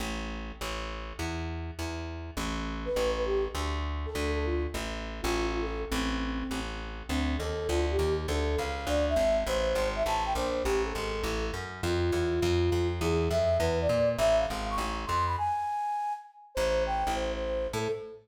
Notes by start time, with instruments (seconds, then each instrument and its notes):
0.00 electric bass (finger) A1
0.61 electric bass (finger) A1
1.19 electric bass (finger) E2
1.79 electric bass (finger) E2
2.37 electric bass (finger) A1
2.85 flute B4
2.96 electric bass (finger) A1
3.17 flute B4
3.26 flute G4
3.55 electric bass (finger) D2
4.06 flute A4
4.15 electric bass (finger) D2
4.35 flute A4
4.45 flute F4
4.74 electric bass (finger) A1
5.22 electric bass (finger) A1, flute F4
5.53 flute F4
5.62 flute A4
5.91 electric bass (finger) A1, flute C4
6.51 electric bass (finger) A1
7.09 electric bass (finger) D2, flute C4
7.38 electric bass (finger) D#2, flute A4
7.68 electric bass (finger) D2, flute F4
7.91 flute G4
7.99 electric bass (finger) D#2
8.28 electric bass (finger) D2, flute A4
8.58 electric bass (finger) C#2, flute F5
8.87 electric bass (finger) D2, flute D5
9.09 flute E5
9.16 electric bass (finger) G#1
9.47 electric bass (finger) A1, flute C5
9.75 electric bass (finger) G#1
9.96 flute E5
10.05 electric bass (finger) A1, flute A5
10.26 flute G5
10.35 electric bass (finger) A#1, flute C5
10.64 electric bass (finger) A1, flute G4
10.85 flute A4
10.95 electric bass (finger) G#1
11.23 electric bass (finger) A1
11.54 electric bass (finger) F#2
11.83 electric bass (finger) F2, flute F4
12.12 electric bass (finger) E2
12.42 electric bass (finger) F2
12.72 electric bass (finger) F2
13.01 electric bass (finger) E2, flute G#4
13.30 electric bass (finger) F2, flute E5
13.59 electric bass (finger) E2, flute B4
13.81 flute D5
13.89 electric bass (finger) A#2
14.18 electric bass (finger) A1, flute E5
14.39 flute F5
14.50 electric bass (finger) G#1
14.70 flute C#6
14.78 electric bass (finger) A1
15.06 electric bass (finger) F2, flute C6
15.26 flute B5
15.38 flute G#5
16.55 electric bass (finger) A1, flute C5
16.86 flute G5
17.07 electric bass (finger) A1
17.14 flute C5
17.34 flute C5
17.73 electric bass (finger) A2, flute A4